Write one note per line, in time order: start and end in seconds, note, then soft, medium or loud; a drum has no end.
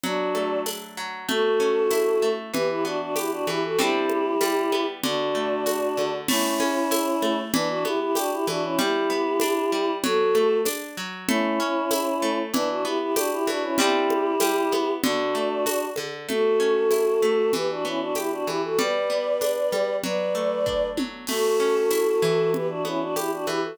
0.03 0.97 F#3 medium
0.03 0.60 D4 loud
0.03 0.60 F#4 loud
0.03 low conga loud
0.35 1.24 A3 medium
0.35 high conga medium
0.66 1.25 D4 medium
0.66 tambourine medium
0.66 high conga medium
0.97 1.27 F#3 medium
1.28 2.22 A3 medium
1.28 2.28 F#4 medium
1.28 2.28 A4 loud
1.28 low conga loud
1.60 2.49 C#4 medium
1.90 2.50 E4 medium
1.90 tambourine medium
1.90 high conga medium
2.22 2.52 A3 medium
2.54 3.47 E3 medium
2.54 2.68 G4 loud
2.54 2.68 B4 loud
2.54 low conga loud
2.69 2.84 E4 medium
2.69 2.84 G4 medium
2.85 3.74 B3 medium
2.85 2.99 D4 medium
2.85 2.99 F#4 loud
3.01 3.15 D4 medium
3.01 3.15 F#4 loud
3.16 3.31 E4 medium
3.16 3.31 G4 medium
3.16 3.75 G4 medium
3.16 tambourine medium
3.16 high conga medium
3.31 3.46 D4 medium
3.31 3.46 F#4 loud
3.47 3.77 E3 medium
3.47 3.63 E4 medium
3.47 3.63 G4 loud
3.47 high conga medium
3.64 3.79 F#4 medium
3.64 3.79 A4 medium
3.78 4.35 G3 medium
3.78 4.35 C4 medium
3.78 4.35 D4 medium
3.78 4.84 E4 medium
3.78 4.84 G4 loud
3.78 low conga loud
4.09 high conga medium
4.41 5.00 G3 medium
4.41 tambourine medium
4.41 high conga medium
4.72 5.02 B3 medium
4.72 high conga medium
5.03 5.97 D3 medium
5.03 6.12 D4 medium
5.03 6.12 F#4 loud
5.03 low conga loud
5.35 6.24 A3 medium
5.66 6.25 F#4 medium
5.66 tambourine medium
5.66 high conga medium
5.97 6.27 D3 medium
5.97 high conga medium
6.28 6.60 A3 medium
6.28 7.37 C#4 medium
6.28 7.37 E4 loud
6.28 crash loud
6.28 low conga loud
6.60 6.91 C#4 medium
6.60 high conga medium
6.91 7.22 E4 medium
6.91 tambourine loud
6.91 high conga loud
7.22 7.52 A3 medium
7.22 high conga medium
7.53 7.85 E3 medium
7.53 7.68 B3 loud
7.53 7.68 D4 loud
7.53 low conga loud
7.69 7.84 D4 loud
7.69 7.84 F#4 loud
7.85 8.16 B3 medium
7.85 8.00 E4 loud
7.85 8.00 G4 loud
7.85 high conga medium
8.01 8.16 E4 medium
8.01 8.16 G4 loud
8.15 8.31 D4 medium
8.15 8.31 F#4 loud
8.15 8.47 G4 medium
8.15 tambourine loud
8.15 high conga medium
8.32 8.46 E4 medium
8.32 8.46 G4 loud
8.47 8.77 E3 medium
8.47 8.62 D4 medium
8.47 8.62 F#4 loud
8.47 high conga medium
8.64 8.79 C#4 medium
8.64 8.79 E4 loud
8.79 9.10 G3 medium
8.79 9.91 E4 loud
8.79 9.91 G4 loud
8.79 low conga loud
9.10 9.41 B3 medium
9.40 9.72 D4 medium
9.40 tambourine medium
9.40 high conga loud
9.72 10.02 G3 medium
10.04 10.35 F#3 medium
10.04 10.58 F#4 loud
10.04 10.58 A4 loud
10.04 low conga loud
10.35 10.66 A3 medium
10.35 high conga medium
10.65 10.97 D4 medium
10.65 tambourine loud
10.65 high conga medium
10.97 11.27 F#3 medium
11.28 11.60 A3 medium
11.28 12.39 C#4 loud
11.28 12.39 E4 loud
11.28 low conga loud
11.60 11.91 C#4 medium
11.91 12.22 E4 medium
11.91 tambourine loud
11.91 high conga loud
12.22 12.52 A3 medium
12.54 12.85 E3 medium
12.54 12.69 B3 loud
12.54 12.68 D4 loud
12.54 low conga loud
12.69 12.84 D4 medium
12.69 12.84 F#4 medium
12.84 13.16 B3 medium
12.84 12.99 E4 medium
12.84 12.99 G4 loud
13.00 13.15 E4 medium
13.00 13.15 G4 loud
13.16 13.31 D4 loud
13.16 13.31 F#4 loud
13.16 13.47 G4 medium
13.16 tambourine loud
13.16 high conga loud
13.32 13.47 E4 medium
13.32 13.47 G4 loud
13.47 13.77 E3 medium
13.47 13.62 D4 medium
13.47 13.62 F#4 medium
13.47 high conga medium
13.63 13.78 C#4 medium
13.63 13.78 E4 medium
13.78 14.35 G3 medium
13.78 14.35 C4 medium
13.78 14.35 D4 medium
13.78 14.91 E4 loud
13.78 14.91 G4 loud
13.78 low conga loud
14.10 high conga loud
14.40 14.72 G3 medium
14.40 tambourine loud
14.40 high conga loud
14.72 15.02 B3 medium
14.72 high conga medium
15.03 15.35 D3 medium
15.03 15.85 D4 loud
15.03 15.85 F#4 loud
15.03 low conga loud
15.35 15.66 A3 medium
15.66 15.97 F#4 medium
15.66 tambourine loud
15.66 high conga medium
15.96 16.27 D3 medium
15.96 high conga loud
16.29 17.22 A3 medium
16.29 17.51 F#4 medium
16.29 17.51 A4 loud
16.29 low conga loud
16.60 17.49 C#4 medium
16.91 17.50 E4 soft
16.91 tambourine medium
16.91 high conga medium
17.22 17.52 A3 medium
17.22 high conga medium
17.53 18.47 E3 medium
17.53 17.69 G4 medium
17.53 17.69 B4 loud
17.53 low conga loud
17.70 17.85 D4 medium
17.70 17.85 F#4 medium
17.85 18.74 B3 medium
17.85 18.00 C#4 medium
17.85 18.00 E4 medium
18.00 18.15 D4 medium
18.00 18.15 F#4 loud
18.15 18.31 E4 medium
18.15 18.31 G4 medium
18.15 18.75 G4 medium
18.15 tambourine medium
18.15 high conga medium
18.31 18.46 D4 medium
18.31 18.46 F#4 medium
18.47 18.77 E3 medium
18.47 18.61 E4 medium
18.47 18.61 G4 loud
18.47 high conga medium
18.63 18.78 F#4 medium
18.63 18.78 A4 medium
18.79 19.72 G3 medium
18.79 19.94 B4 medium
18.79 19.94 D5 loud
18.79 low conga loud
19.10 19.99 B3 soft
19.41 20.00 D4 medium
19.41 tambourine medium
19.41 high conga medium
19.72 20.02 G3 medium
19.72 high conga medium
20.04 20.97 F#3 medium
20.04 20.87 B4 medium
20.04 20.87 D5 loud
20.04 low conga loud
20.35 21.24 A3 medium
20.66 21.25 D4 medium
20.66 kick medium
20.97 21.27 F#3 medium
20.97 high tom loud
21.27 22.47 A3 medium
21.27 22.51 F#4 medium
21.27 22.51 A4 loud
21.27 crash loud
21.27 low conga loud
21.60 22.49 C#4 medium
21.90 22.50 E4 medium
21.90 tambourine medium
21.90 high conga medium
22.22 23.47 E3 medium
22.53 22.67 G4 medium
22.53 22.67 B4 medium
22.53 low conga loud
22.69 22.83 D4 medium
22.69 22.83 F#4 medium
22.85 23.74 B3 medium
22.85 23.01 C#4 medium
22.85 23.01 E4 medium
22.85 high conga medium
23.00 23.15 D4 medium
23.00 23.15 F#4 medium
23.16 23.31 E4 medium
23.16 23.75 G4 medium
23.16 23.31 G4 medium
23.16 tambourine medium
23.16 high conga medium
23.31 23.46 D4 medium
23.31 23.46 F#4 medium
23.46 23.77 E3 medium
23.46 23.61 E4 medium
23.46 23.61 G4 loud
23.46 high conga medium
23.63 23.78 F#4 medium
23.63 23.78 A4 medium